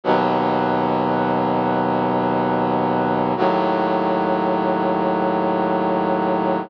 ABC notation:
X:1
M:4/4
L:1/8
Q:1/4=72
K:E
V:1 name="Brass Section" clef=bass
[D,,B,,F,]8 | [D,,A,,F,]8 |]